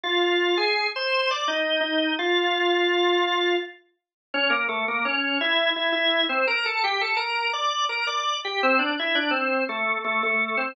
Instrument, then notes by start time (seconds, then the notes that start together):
drawbar organ
0.04 F4 F5
0.57 G#4 G#5
0.96 C5 C6
1.31 D5 D6
1.48 D#4 D#5
1.81 D#4 D#5
2.19 F4 F5
4.34 C#4 C#5
4.50 A#3 A#4
4.69 A3 A4
4.88 A#3 A#4
5.05 C#4 C#5
5.41 E4 E5
5.76 E4 E5
5.92 E4 E5
6.29 C4 C5
6.47 A#4 A#5
6.66 A4 A5
6.84 G4 G5
7.01 A4 A5
7.17 A#4 A#5
7.53 D5 D6
7.89 A#4 A#5
8.07 D5 D6
8.45 G4 G5
8.63 C4 C5
8.79 D4 D5
8.99 E4 E5
9.15 D4 D5
9.31 C4 C5
9.69 A3 A4
10.04 A3 A4
10.23 A3 A4
10.57 C4 C5